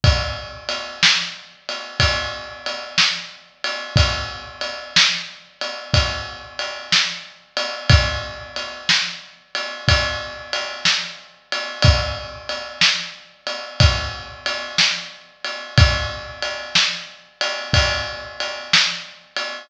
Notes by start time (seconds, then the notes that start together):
0.04 kick, ride
0.69 ride
1.03 snare
1.69 ride
2.00 kick, ride
2.66 ride
2.98 snare
3.64 ride
3.96 kick, ride
4.61 ride
4.96 snare
5.61 ride
5.94 kick, ride
6.59 ride
6.92 snare
7.57 ride
7.90 kick, ride
8.56 ride
8.89 snare
9.55 ride
9.88 kick, ride
10.53 ride
10.85 snare
11.52 ride
11.82 kick, ride
12.49 ride
12.81 snare
13.47 ride
13.80 kick, ride
14.46 ride
14.78 snare
15.45 ride
15.78 kick, ride
16.42 ride
16.75 snare
17.41 ride
17.73 kick, ride
18.40 ride
18.73 snare
19.36 ride